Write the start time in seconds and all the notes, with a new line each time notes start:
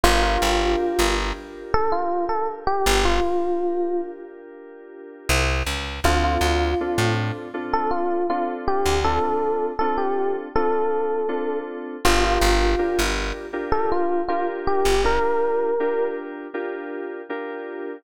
0.03 G1 D4 F4 G4 A#4
0.23 F4
0.42 G1
0.99 G1
1.74 A4
1.92 F4
2.29 A4
2.67 G4
2.86 G1
3.05 F4
5.29 C2
5.66 C#2
6.04 D2 C4 D4 F4 A4
6.24 F4
6.41 D2
6.80 C4 D4 F4 A4
6.98 A2
7.54 C4 D4 F4 A4
7.73 A4
7.91 F4
8.29 C4 D4 F4 A4
8.68 G4
8.85 D2
9.04 C4 D4 F4 A4
9.79 C4 D4 F4 A4
9.98 G4
10.55 C4 D4 F4 A4
11.28 C4 D4 F4 A4
12.05 G1 D4 F4 G4 A#4
12.24 F4
12.41 G1
12.78 D4 F4 G4 A#4
12.99 G1
13.53 D4 F4 G4 A#4
13.72 A4
13.92 F4
14.28 D4 F4 G4 A#4
14.67 G4
14.85 G1
15.04 D4 F4 G4 A#4
15.80 D4 F4 G4 A#4
16.54 D4 F4 G4 A#4
17.29 D4 F4 G4 A#4